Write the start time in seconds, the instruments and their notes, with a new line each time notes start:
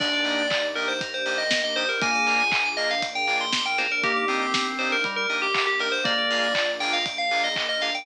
0.00 synth bass 2 D#2, drawbar organ A#3 D4 D#4 G4, string ensemble 1 A#3 D4 D#4 G4, electric piano 2 A#4, tubular bells D5, kick, crash
0.13 electric piano 2 D5
0.25 drawbar organ A#3 D4 D#4 G4, electric piano 2 D#5, open hi-hat
0.38 electric piano 2 G5
0.50 electric piano 2 A#5, kick, clap
0.63 electric piano 2 D6
0.75 drawbar organ A#3 D4 D#4 G4, tubular bells A#4, electric piano 2 D#6, open hi-hat
0.88 tubular bells C5, electric piano 2 G6
1.01 string ensemble 1 A#3 D4 G4 A#4, electric piano 2 A#4, kick, closed hi-hat
1.13 tubular bells C5, electric piano 2 D5
1.26 drawbar organ A#3 D4 D#4 G4, electric piano 2 D#5, open hi-hat
1.38 tubular bells D#5, electric piano 2 G5
1.51 electric piano 2 A#5, kick, snare
1.64 tubular bells D#5, electric piano 2 D6
1.76 drawbar organ A#3 D4 D#4 G4, tubular bells C5, electric piano 2 D#6, open hi-hat
1.89 tubular bells A#4, electric piano 2 G6
2.01 synth bass 2 A#1, string ensemble 1 A#3 D4 F4 G#4, drawbar organ A#3 D4 F4 G#4, electric piano 2 A#4, tubular bells G#5, kick, closed hi-hat
2.14 electric piano 2 D5
2.27 drawbar organ A#3 D4 F4 G#4, electric piano 2 F5, open hi-hat
2.39 electric piano 2 G#5
2.51 electric piano 2 A#5, kick, clap
2.65 electric piano 2 D6
2.77 drawbar organ A#3 D4 F4 G#4, tubular bells D#5, electric piano 2 F6, open hi-hat
2.90 electric piano 2 A#4, tubular bells F5
3.02 string ensemble 1 A#3 D4 G#4 A#4, electric piano 2 D5, kick, closed hi-hat
3.15 electric piano 2 F5, tubular bells G5
3.27 drawbar organ A#3 D4 F4 G#4, electric piano 2 G#5, open hi-hat
3.40 electric piano 2 A#5, tubular bells C6
3.53 electric piano 2 D6, kick, snare
3.66 tubular bells G5, electric piano 2 F6
3.78 drawbar organ A#3 D4 F4 G#4, electric piano 2 A#4, tubular bells C5, snare
3.91 tubular bells A#4, electric piano 2 D5
4.01 synth bass 2 A#1, string ensemble 1 A#3 D4 D#4 G4, drawbar organ A#3 D4 D#4 G4, tubular bells G4, electric piano 2 A#4, kick, closed hi-hat
4.16 electric piano 2 D5
4.28 drawbar organ A#3 C4 D4 D#4 G4, electric piano 2 D#5, open hi-hat
4.41 electric piano 2 G5
4.54 electric piano 2 A#5, kick, snare
4.66 electric piano 2 D6
4.79 drawbar organ A#3 D4 D#4 G4, tubular bells C5, electric piano 2 D#6, open hi-hat
4.91 tubular bells A#4, electric piano 2 G6
5.04 drawbar organ G3, string ensemble 1 A#3 D4 G4 A#4, electric piano 2 A#4, kick, closed hi-hat
5.16 tubular bells A#4, electric piano 2 D5
5.29 drawbar organ A#3 D4 D#4 G4, electric piano 2 D#5, open hi-hat
5.42 tubular bells G4, electric piano 2 G5
5.54 electric piano 2 A#5, kick, clap
5.67 tubular bells G4, electric piano 2 D6
5.80 drawbar organ A#3 D4 D#4 G4, tubular bells A#4, electric piano 2 D#6, open hi-hat
5.92 tubular bells C5, electric piano 2 G6
6.04 synth bass 2 A#1, drawbar organ A#3 D4 F4 G#4, string ensemble 1 A#3 D4 F4 G#4, electric piano 2 A#4, tubular bells D5, kick, closed hi-hat
6.18 electric piano 2 D5
6.30 drawbar organ A#3 D4 F4 G#4, electric piano 2 F5, open hi-hat
6.43 electric piano 2 G#5
6.55 electric piano 2 A#5, kick, clap
6.68 electric piano 2 D6
6.80 drawbar organ A#3 D4 F4 G#4, tubular bells G5, electric piano 2 F6, open hi-hat
6.93 electric piano 2 A#4, tubular bells F5
7.06 string ensemble 1 A#3 D4 G#4 A#4, electric piano 2 D5, kick, closed hi-hat
7.18 tubular bells F5, electric piano 2 F5
7.31 drawbar organ A#3 D4 F4 G#4, electric piano 2 G#5, open hi-hat
7.44 tubular bells D#5, electric piano 2 A#5
7.56 electric piano 2 D6, kick, clap
7.69 tubular bells D#5, electric piano 2 F6
7.81 drawbar organ A#3 D4 F4 G#4, electric piano 2 A#4, tubular bells F5, open hi-hat
7.94 electric piano 2 D5, tubular bells G5